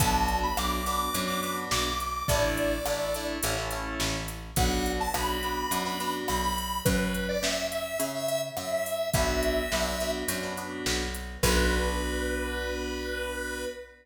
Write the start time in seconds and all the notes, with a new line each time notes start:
0.00 B1 B3 D4 F#4 A5, kick, closed hi-hat
0.28 closed hi-hat
0.43 B5
0.57 B1 B3 D4 F#4 D6, cross-stick
0.86 B3 D4 F#4 D6, closed hi-hat
1.13 F#2 B3 D4 F#4, closed hi-hat
1.27 B3 D4 F#4 D6
1.43 B3 D4 F#4 D6, closed hi-hat
1.71 B1 D6, snare
1.85 D6
2.00 closed hi-hat
2.28 A1 A3 D4 E4 D5, kick, closed hi-hat
2.58 closed hi-hat
2.86 A1 A3 D4 E4, cross-stick
3.14 A3 D4 E4, closed hi-hat
3.43 A1 A3 C#4 E4, closed hi-hat
3.57 A3 C#4 E4
3.71 A3 C#4 E4, closed hi-hat
4.00 A1, snare
4.28 closed hi-hat
4.56 B1 B3 D4 F#4 F#5, kick, closed hi-hat
4.86 closed hi-hat
5.00 A5
5.14 B1 B3 D4 F#4 B5, cross-stick
5.43 B3 D4 F#4 B5, closed hi-hat
5.71 F#2 B3 D4 F#4, closed hi-hat
5.85 B3 D4 F#4 B5
6.00 B3 D4 F#4 B5, closed hi-hat
6.28 B1 B5, cross-stick
6.43 B5
6.58 closed hi-hat
6.85 F#2 B4, kick, closed hi-hat
7.14 closed hi-hat
7.29 D5
7.43 F#2 E5, snare
7.71 E5, closed hi-hat
8.00 C#3, closed hi-hat
8.15 E5
8.28 E5, closed hi-hat
8.57 F#2 E5, cross-stick
8.72 E5
8.86 open hi-hat
9.14 B1 B3 D4 F#4 E5, kick, closed hi-hat
9.43 closed hi-hat
9.72 B1 B3 D4 F#4, snare
10.00 B3 D4 F#4, closed hi-hat
10.28 F#2 B3 D4 F#4, closed hi-hat
10.42 B3 D4 F#4
10.57 B3 D4 F#4, closed hi-hat
10.86 B1, snare
11.15 closed hi-hat
11.43 B1 B3 D4 F#4 B4, kick, crash